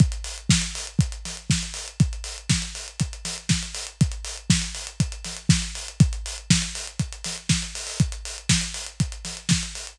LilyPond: \new DrumStaff \drummode { \time 4/4 \tempo 4 = 120 <hh bd>16 hh16 hho16 hh16 <bd sn>16 hh16 hho16 hh16 <hh bd>16 hh16 <hho sn>16 hh16 <bd sn>16 hh16 hho16 hh16 | <hh bd>16 hh16 hho16 hh16 <bd sn>16 hh16 hho16 hh16 <hh bd>16 hh16 <hho sn>16 hh16 <bd sn>16 hh16 hho16 hh16 | <hh bd>16 hh16 hho16 hh16 <bd sn>16 hh16 hho16 hh16 <hh bd>16 hh16 <hho sn>16 hh16 <bd sn>16 hh16 hho16 hh16 | <hh bd>16 hh16 hho16 hh16 <bd sn>16 hh16 hho16 hh16 <hh bd>16 hh16 <hho sn>16 hh16 <bd sn>16 hh16 hho16 hho16 |
<hh bd>16 hh16 hho16 hh16 <bd sn>16 hh16 hho16 hh16 <hh bd>16 hh16 <hho sn>16 hh16 <bd sn>16 hh16 hho16 hh16 | }